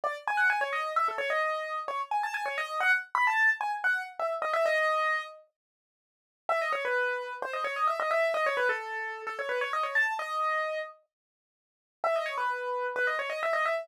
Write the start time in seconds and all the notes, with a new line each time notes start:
0.04 D5
0.27 G#5
0.37 F#5
0.50 G#5
0.61 C#5
0.73 D#5
0.96 E5
1.08 A4
1.18 C#5
1.30 D#5
1.88 C#5
2.11 G#5
2.23 A5
2.34 G#5
2.46 C#5
2.58 D#5
2.80 F#5
3.15 B5
3.27 A5
3.61 G#5
3.84 F#5
4.19 E5
4.42 D#5
4.53 E5
4.66 D#5
6.49 E5
6.61 D#5
6.72 C#5
6.85 B4
7.42 C5
7.53 D#5
7.64 C#5
7.76 D#5
7.87 E5
8.00 D#5
8.11 E5
8.34 D#5
8.46 C#5
8.57 B4
8.69 A4
9.27 A4
9.39 C#5
9.49 B4
9.61 C#5
9.73 D#5
9.83 C#5
9.95 A5
10.19 D#5
12.04 E5
12.16 D#5
12.26 C#5
12.37 B4
12.96 B4
13.07 D#5
13.19 C#5
13.30 D#5
13.43 E5
13.53 D#5
13.65 E5